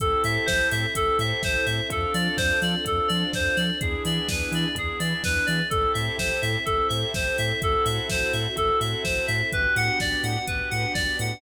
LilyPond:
<<
  \new Staff \with { instrumentName = "Electric Piano 2" } { \time 4/4 \key a \minor \tempo 4 = 126 a'8 e''8 c''8 e''8 a'8 e''8 c''8 e''8 | a'8 d''8 c''8 d''8 a'8 d''8 c''8 d''8 | gis'8 d''8 b'8 d''8 gis'8 d''8 b'8 d''8 | a'8 e''8 c''8 e''8 a'8 e''8 c''8 e''8 |
a'8 e''8 c''8 e''8 a'8 e''8 c''8 e''8 | b'8 fis''8 d''8 fis''8 b'8 fis''8 d''8 fis''8 | }
  \new Staff \with { instrumentName = "Drawbar Organ" } { \time 4/4 \key a \minor <c' e' g' a'>2 <c' e' g' a'>2 | <c' d' f' a'>2 <c' d' f' a'>2 | <b d' e' gis'>2 <b d' e' gis'>2 | <c' e' g' a'>2 <c' e' g' a'>2 |
<c' e' fis' a'>2 <c' e' fis' a'>2 | <b d' fis' g'>2 <b d' fis' g'>2 | }
  \new Staff \with { instrumentName = "Synth Bass 2" } { \clef bass \time 4/4 \key a \minor a,,8 a,8 a,,8 a,8 a,,8 a,8 a,,8 a,8 | f,8 f8 f,8 f8 f,8 f8 f,8 f8 | e,8 e8 e,8 e8 e,8 e8 e,8 e8 | a,,8 a,8 a,,8 a,8 a,,8 a,8 a,,8 a,8 |
a,,8 a,8 a,,8 a,8 a,,8 a,8 a,,8 a,8 | a,,8 a,8 a,,8 a,8 a,,8 a,8 a,,8 a,8 | }
  \new Staff \with { instrumentName = "String Ensemble 1" } { \time 4/4 \key a \minor <c' e' g' a'>2 <c' e' a' c''>2 | <c' d' f' a'>2 <c' d' a' c''>2 | <b d' e' gis'>2 <b d' gis' b'>2 | <c' e' g' a'>2 <c' e' a' c''>2 |
<c' e' fis' a'>2 <c' e' a' c''>2 | <b d' fis' g'>2 <b d' g' b'>2 | }
  \new DrumStaff \with { instrumentName = "Drums" } \drummode { \time 4/4 <hh bd>8 hho8 <bd sn>8 hho8 <hh bd>8 hho8 <bd sn>8 hho8 | <hh bd>8 hho8 <bd sn>8 hho8 <hh bd>8 hho8 <bd sn>8 hho8 | <hh bd>8 hho8 <bd sn>8 hho8 <hh bd>8 hho8 <bd sn>8 hho8 | <hh bd>8 hho8 <bd sn>8 hho8 <hh bd>8 hho8 <bd sn>8 hho8 |
<hh bd>8 hho8 <bd sn>8 hho8 <hh bd>8 hho8 <bd sn>8 hho8 | <hh bd>8 hho8 <bd sn>8 hho8 <hh bd>8 hho8 <bd sn>8 hho8 | }
>>